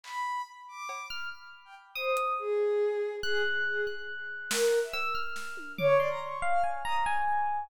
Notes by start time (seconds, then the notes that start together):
0.03 B5, clap
0.68 D6
0.89 cowbell
1.10 F6
1.65 G5
1.95 C5 D#6
2.17 closed hi-hat
2.39 G#4
3.23 G#4 F#6
3.66 G#4
3.87 F#6
4.50 A#4, snare
4.72 cowbell
4.83 E5
4.93 E6, cowbell
5.15 F6
5.36 snare
5.57 high tom
5.78 C#5 D6, floor tom
5.99 D5 C6
6.10 A#5
6.21 C#6
6.42 F5
6.53 F6
6.64 G#5
6.85 A#5 D#6
7.06 G#5